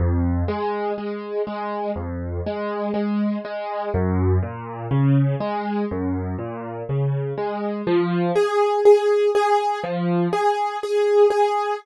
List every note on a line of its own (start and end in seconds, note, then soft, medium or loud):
0.00 0.43 F2 medium
0.48 0.92 G#3 medium
0.98 1.42 G#3 medium
1.47 1.91 G#3 medium
1.96 2.40 F2 medium
2.47 2.91 G#3 medium
2.94 3.38 G#3 medium
3.45 3.89 G#3 medium
3.94 4.38 F#2 medium
4.43 4.87 A#2 medium
4.91 5.35 C#3 medium
5.40 5.85 G#3 medium
5.91 6.35 F#2 medium
6.39 6.83 A#2 medium
6.89 7.33 C#3 medium
7.38 7.82 G#3 medium
7.87 8.31 F3 medium
8.35 8.80 G#4 medium
8.85 9.30 G#4 medium
9.35 9.79 G#4 medium
9.84 10.28 F3 medium
10.33 10.77 G#4 medium
10.83 11.27 G#4 medium
11.30 11.75 G#4 medium